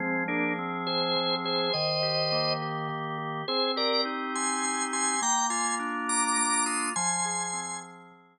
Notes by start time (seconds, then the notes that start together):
0.00 F3 G#3 C4
0.28 A#3 D4 G#4
0.58 C4
0.87 G#4 C5
1.16 F3
1.44 G#4 C5
1.73 D#3 C5 D#5
2.03 G4
2.32 A#3
2.62 G4
2.89 D#3
3.18 G4
3.48 C4 G#4 C5
3.76 G4 A#4 D5
4.05 D#4
4.34 G4 G#5 C6
4.64 C4
4.93 G4 G#5 C6
5.22 A#3 G5 A#5
5.50 F4 G#5 C6
5.79 D4
6.08 F4 A#5 D6
6.38 A#3
6.66 F4 C6 D#6
6.96 F3 G#5 C6
7.25 G#4
7.53 C4
7.83 G#4
8.11 F3